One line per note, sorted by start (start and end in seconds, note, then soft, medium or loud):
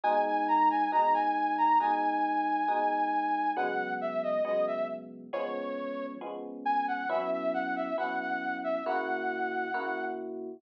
0.03 0.83 B2 loud
0.03 0.83 G#3 loud
0.03 0.83 D#4 loud
0.03 0.24 G#5 loud
0.26 0.47 G#5 loud
0.48 0.69 A#5 loud
0.70 0.91 G#5 loud
0.92 1.72 B2 loud
0.92 1.72 G#3 loud
0.92 1.72 D#4 loud
0.92 1.13 A#5 loud
1.14 1.57 G#5 loud
1.58 1.79 A#5 loud
1.80 2.60 B2 medium
1.80 2.60 G#3 loud
1.80 2.60 D#4 loud
1.80 3.53 G#5 loud
2.68 3.48 B2 loud
2.68 3.48 G#3 loud
2.68 3.48 D#4 loud
3.56 4.36 C#3 loud
3.56 4.36 F#3 loud
3.56 4.36 G#3 loud
3.56 4.36 B3 loud
3.56 3.94 F#5 loud
4.01 4.22 E5 loud
4.23 4.44 D#5 loud
4.45 5.24 C#3 loud
4.45 5.24 F#3 loud
4.45 5.24 G#3 loud
4.45 5.24 B3 loud
4.45 4.66 D#5 loud
4.67 4.88 E5 medium
5.33 6.13 F3 loud
5.33 6.13 G#3 loud
5.33 6.13 B3 loud
5.33 6.13 C#4 loud
5.33 6.06 C#5 loud
6.21 7.01 F3 loud
6.21 7.01 G#3 loud
6.21 7.01 B3 loud
6.21 7.01 C#4 loud
6.65 6.86 G#5 medium
6.88 7.09 F#5 loud
7.09 7.89 F#3 loud
7.09 7.89 B3 loud
7.09 7.89 C#4 loud
7.09 7.89 E4 loud
7.09 7.30 E5 loud
7.31 7.52 E5 loud
7.54 7.75 F#5 loud
7.76 7.97 E5 loud
7.98 8.77 F#3 loud
7.98 8.77 B3 medium
7.98 8.77 C#4 loud
7.98 8.77 E4 loud
7.98 8.19 F#5 loud
8.20 8.57 F#5 loud
8.64 8.85 E5 loud
8.86 9.66 C#3 loud
8.86 9.66 A#3 loud
8.86 9.66 E4 loud
8.86 9.66 F#4 loud
8.86 10.05 F#5 loud
9.74 10.54 C#3 medium
9.74 10.54 A#3 loud
9.74 10.54 E4 loud
9.74 10.54 F#4 loud